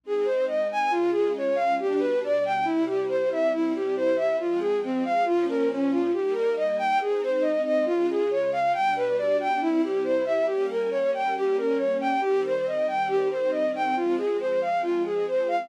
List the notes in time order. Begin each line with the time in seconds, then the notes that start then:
0.04 G#3 C4 D#4 G#4
0.25 C5
0.48 D#5
0.72 G#5
0.91 C#3 G#3 F4
1.13 G#4
1.37 C#5
1.55 F5
1.79 B2 G3 D4 G4
1.99 B4
2.24 D5
2.45 G5
2.65 C3 G3 E4
2.86 G4
3.09 C5
3.32 E5
3.52 C3 G3 E4
3.76 G4
3.97 C5
4.16 E5
4.40 F3 G#3 C4 F4
4.60 G#4
4.84 C4
5.05 F5
5.25 A#2 F3 C#4 F4
5.49 A#4
5.71 C#4
5.90 F4
6.13 G3 A#3 D#4 G4
6.35 A#4
6.56 D#5
6.79 G5
7.01 G#3 C4 D#4 G#4
7.23 C5
7.42 D#5
7.65 D#5
7.86 C#3 G#3 F4
8.10 G#4
8.31 C#5
8.52 F5
8.73 B2 G3 D4 G5
8.96 B4
9.18 D5
9.40 G5
9.61 C3 G3 E4
9.84 G4
10.04 C5
10.25 E5
10.46 G3 A#3 C#4 G4
10.70 A#4
10.91 C#5
11.14 G5
11.37 G4
11.58 A#4
11.77 C#5
12.00 G5
12.21 D#3 G3 C4 G4
12.46 C5
12.67 D#5
12.88 G5
13.08 G4
13.31 C5
13.51 D#5
13.75 G5
13.96 F3 G#3 C4 F4
14.17 G#4
14.40 C5
14.62 F5
14.83 F4
15.06 G#4
15.28 C5
15.48 F5